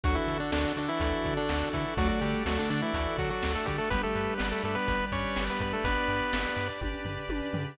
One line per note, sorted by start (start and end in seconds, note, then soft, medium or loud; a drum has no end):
0.04 0.18 D2 loud
0.04 0.16 F#3 medium
0.04 1.85 D4 loud
0.04 1.96 D4 medium
0.04 0.76 F#4 medium
0.04 1.96 F#4 medium
0.04 0.16 F#4 medium
0.04 1.96 A4 medium
0.04 kick medium
0.04 closed hi-hat medium
0.15 0.38 E3 medium
0.15 0.38 E4 medium
0.28 0.41 D3 medium
0.28 1.00 A4 medium
0.28 closed hi-hat medium
0.40 0.51 D3 medium
0.40 0.51 D4 medium
0.52 0.66 D2 medium
0.52 0.73 D3 medium
0.52 0.73 D4 medium
0.52 1.24 D5 medium
0.52 snare medium
0.77 0.90 D3 medium
0.77 0.90 D4 medium
0.77 1.49 F#4 medium
0.77 closed hi-hat medium
0.89 1.34 E3 medium
0.89 1.34 E4 medium
1.00 1.13 D2 medium
1.00 1.73 A4 medium
1.00 kick medium
1.00 closed hi-hat medium
1.25 1.39 D3 medium
1.25 1.97 D5 medium
1.25 kick medium
1.25 closed hi-hat medium
1.37 1.69 D3 medium
1.37 1.69 D4 medium
1.49 1.63 D2 medium
1.49 2.21 F#4 medium
1.49 snare medium
1.73 1.86 D3 medium
1.73 1.94 E3 medium
1.73 1.94 E4 medium
1.73 2.46 A4 medium
1.73 kick medium
1.73 closed hi-hat medium
1.97 2.11 D2 loud
1.97 2.08 F#3 medium
1.97 2.42 A3 loud
1.97 3.89 D4 medium
1.97 2.08 F#4 loud
1.97 3.89 A4 medium
1.97 2.70 D5 medium
1.97 3.89 D5 medium
1.97 kick loud
1.97 closed hi-hat medium
2.09 2.20 F#3 medium
2.09 2.20 F#4 medium
2.21 2.35 D3 loud
2.21 2.44 G3 medium
2.21 2.94 F#4 medium
2.21 2.44 G4 medium
2.21 closed hi-hat medium
2.45 2.59 D2 medium
2.45 2.58 F#3 medium
2.45 2.91 A3 medium
2.45 2.58 F#4 medium
2.45 3.18 A4 medium
2.45 snare medium
2.59 2.69 D3 medium
2.59 2.69 D4 medium
2.70 2.81 D3 medium
2.70 2.83 D3 loud
2.70 2.81 D4 medium
2.70 3.42 D5 medium
2.70 closed hi-hat medium
2.82 3.17 E3 medium
2.82 3.17 E4 medium
2.94 3.07 D2 loud
2.94 3.67 F#4 medium
2.94 kick medium
2.94 closed hi-hat medium
3.18 3.31 D3 medium
3.18 3.30 F#3 medium
3.18 3.30 F#4 medium
3.18 3.87 A4 medium
3.18 kick medium
3.18 closed hi-hat medium
3.30 3.53 F#3 medium
3.30 3.53 F#4 medium
3.43 3.56 D2 medium
3.43 3.89 D5 medium
3.43 snare medium
3.55 3.67 A3 medium
3.55 3.67 A4 medium
3.65 3.80 D3 loud
3.65 3.77 G3 medium
3.65 3.90 F#4 medium
3.65 3.77 G4 medium
3.65 kick medium
3.65 closed hi-hat medium
3.78 3.90 A3 medium
3.78 3.90 A4 medium
3.90 4.05 G1 loud
3.90 5.78 G3 loud
3.90 4.02 B3 medium
3.90 5.83 D4 medium
3.90 4.63 G4 medium
3.90 5.83 G4 medium
3.90 4.02 B4 medium
3.90 5.83 B4 medium
3.90 kick medium
3.90 closed hi-hat medium
4.03 4.34 A3 medium
4.03 4.34 A4 medium
4.15 4.29 G2 medium
4.15 4.87 B4 medium
4.15 closed hi-hat medium
4.38 4.54 G1 loud
4.38 4.49 B3 medium
4.38 4.49 B4 medium
4.38 5.11 D5 medium
4.38 snare medium
4.51 4.63 A3 medium
4.51 4.63 A4 medium
4.64 4.77 G2 loud
4.64 4.76 A3 medium
4.64 5.36 G4 medium
4.64 4.76 A4 medium
4.64 closed hi-hat medium
4.75 5.06 B3 medium
4.75 5.06 B4 medium
4.88 5.02 G1 loud
4.88 5.60 B4 medium
4.88 kick medium
4.88 closed hi-hat medium
5.12 5.25 G2 medium
5.12 5.44 C#4 medium
5.12 5.44 C#5 medium
5.12 5.84 D5 medium
5.12 kick medium
5.12 closed hi-hat medium
5.36 5.50 G1 medium
5.36 6.08 G4 medium
5.36 snare medium
5.50 5.61 B3 medium
5.50 5.61 B4 medium
5.60 5.73 G2 medium
5.60 5.73 B3 medium
5.60 6.33 B4 medium
5.60 5.73 B4 medium
5.60 kick medium
5.60 closed hi-hat medium
5.73 5.84 A3 medium
5.73 5.84 A4 medium
5.84 5.97 G1 medium
5.84 6.68 B3 medium
5.84 7.76 D4 medium
5.84 6.55 D4 medium
5.84 7.76 B4 medium
5.84 6.68 B4 medium
5.84 7.76 D5 medium
5.84 6.56 D5 medium
5.84 kick medium
5.84 closed hi-hat medium
6.08 6.22 G2 medium
6.08 6.81 G4 medium
6.08 closed hi-hat medium
6.33 6.47 G1 medium
6.33 7.05 B4 medium
6.33 snare medium
6.57 6.70 G2 loud
6.57 7.29 D5 medium
6.57 closed hi-hat medium
6.81 6.95 G1 loud
6.81 7.54 G4 medium
6.81 kick medium
6.81 high tom medium
7.05 7.18 G2 medium
7.05 7.75 B4 medium
7.05 floor tom medium
7.29 7.42 G1 medium
7.29 7.76 D5 medium
7.29 high tom medium
7.53 7.67 G2 medium
7.53 7.77 G4 medium
7.53 floor tom medium